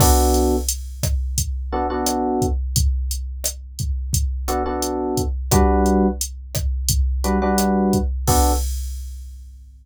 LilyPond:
<<
  \new Staff \with { instrumentName = "Electric Piano 1" } { \time 4/4 \key b \minor \tempo 4 = 87 <b d' fis' a'>2~ <b d' fis' a'>8 <b d' fis' a'>16 <b d' fis' a'>4~ <b d' fis' a'>16~ | <b d' fis' a'>2~ <b d' fis' a'>8 <b d' fis' a'>16 <b d' fis' a'>4~ <b d' fis' a'>16 | <g d' fis' b'>2~ <g d' fis' b'>8 <g d' fis' b'>16 <g d' fis' b'>4~ <g d' fis' b'>16 | <b d' fis' a'>4 r2. | }
  \new DrumStaff \with { instrumentName = "Drums" } \drummode { \time 4/4 <cymc bd ss>8 hh8 hh8 <hh bd ss>8 <hh bd>4 <hh ss>8 <hh bd>8 | <hh bd>8 hh8 <hh ss>8 <hh bd>8 <hh bd>8 <hh ss>8 hh8 <hh bd>8 | <hh bd ss>8 hh8 hh8 <hh bd ss>8 <hh bd>8 hh8 <hh ss>8 <hh bd>8 | <cymc bd>4 r4 r4 r4 | }
>>